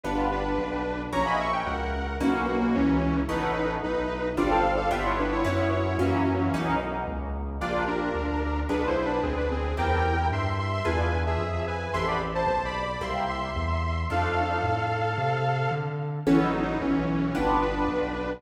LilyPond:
<<
  \new Staff \with { instrumentName = "Lead 2 (sawtooth)" } { \time 4/4 \key a \lydian \partial 2 \tempo 4 = 111 <d' b'>8 <d' b'>4. | <cis'' ais''>16 <dis'' b''>16 <e'' cis'''>16 g''16 <ais' fis''>4 <ais fis'>8 <ais fis'>16 <ais fis'>16 <e cis'>4 | <dis' b'>4 <dis' b'>4 <f' d''>16 <a' f''>8 <a' f''>16 <g' e''>16 <e' cis''>16 <d' b'>16 <e' cis''>16 | <e' cis''>8 <e' cis''>8 <e cis'>4. r4. |
\key bes \lydian <f' d''>8 <d' bes'>4. \tuplet 3/2 { <d' b'>8 <e' c''>8 <d' b'>8 } <c' aes'>16 <d' b'>16 <c' aes'>8 | <bes' g''>4 <e'' c'''>8 <e'' c'''>16 <e'' c'''>16 <b' gis''>8. <gis' e''>8. <b' gis''>8 | <e'' c'''>16 <d'' b''>16 r16 <c'' a''>16 \tuplet 3/2 { <c'' a''>8 <d'' b''>8 <d'' b''>8 } <e'' c'''>8 <e'' c'''>4. | <a' f''>2.~ <a' f''>8 r8 |
\key a \lydian \tuplet 3/2 { <e cis'>8 <fis dis'>8 <fis dis'>8 } <e cis'>4 <d' b'>8 <d' b'>4. | }
  \new Staff \with { instrumentName = "Orchestral Harp" } { \time 4/4 \key a \lydian \partial 2 <b d' f' g'>2 | <ais cis' e' fis'>2 <ais b cis' dis'>2 | <a b cis' e'>2 <g c' d' f'>4 <g b d' f'>4 | <fis b cis' e'>4 <fis ais cis' e'>4 <ais b cis' dis'>2 |
\key bes \lydian <bes d' f' g'>2 <b d' f' aes'>2 | <c' e' g' a'>2 <d' e' f' gis'>2 | <b c' g' a'>2 <bes c' e' g'>2 | <a d' ees' f'>1 |
\key a \lydian <b cis' e' a'>2 <b d' f' g'>2 | }
  \new Staff \with { instrumentName = "Synth Bass 1" } { \clef bass \time 4/4 \key a \lydian \partial 2 g,,4 b,,4 | ais,,4 cis,4 b,,4 cis,4 | a,,4 b,,4 g,,4 g,,4 | fis,4 fis,4 b,,4 cis,4 |
\key bes \lydian bes,,4 d,4 b,,4 d,4 | e,4 g,4 e,4 f,4 | a,,4 b,,4 c,4 e,4 | f,4 a,4 c4 d4 |
\key a \lydian a,,4 b,,4 g,,4 b,,4 | }
>>